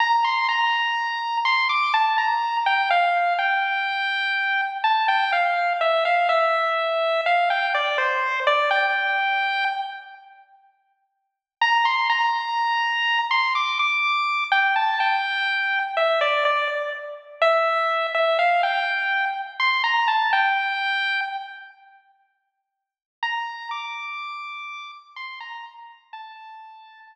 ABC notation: X:1
M:3/4
L:1/16
Q:1/4=62
K:Gdor
V:1 name="Lead 1 (square)"
b c' b4 c' d' a b2 g | f2 g6 a g f2 | e f e4 f g d c2 d | g4 z8 |
b c' b5 c' d' d'3 | g a g4 e d d z3 | e3 e f g3 z c' b a | g4 z8 |
b2 d'6 c' b z2 | a4 z8 |]